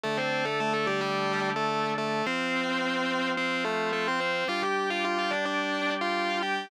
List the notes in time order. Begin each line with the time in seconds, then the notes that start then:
0.04 D3 A3 D4 A4
0.17 C4 C5
0.45 A3 A4
0.60 A3 A4
0.73 A3 A4
0.87 G3 G4
1.01 G3 G4
1.56 A3 A4
1.98 A3 A4
2.26 F3 C4 F4 C5
3.37 C4 C5
3.65 A3 A4
3.93 A3 A4
4.08 C4 C5
4.20 C4 C5
4.48 G3 D4 F4 G4 F5
4.62 G4 G5
4.90 F4 F5
5.05 F4 F5
5.19 F4 F5
5.31 D4 D5
5.45 D4 D5
6.01 F4 F5
6.43 G4 G5